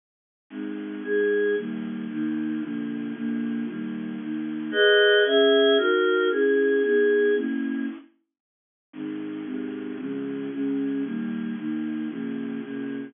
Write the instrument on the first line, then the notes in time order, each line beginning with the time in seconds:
choir aahs
0.50 G#3 C4 D#4
1.03 G#3 D#4 G#4
1.56 D#3 G3 A#3
2.09 D#3 A#3 D#4
2.61 D3 F3 A#3
3.14 A#2 D3 A#3
3.66 D#3 G3 A#3
4.20 D#3 A#3 D#4
4.71 G#4 B4 D#5
5.25 C#4 G#4 E5
5.77 D#4 F#4 A#4
6.30 C#4 E4 G#4
6.83 B3 D#4 G#4
7.35 A#3 C#4 E4
8.93 G#2 D#3 C4
9.45 G#2 C3 C4
9.98 C#3 F3 G#3
10.52 C#3 G#3 C#4
11.03 D#3 G3 A#3
11.56 D#3 A#3 D#4
12.09 C#3 F3 A#3
12.61 A#2 C#3 A#3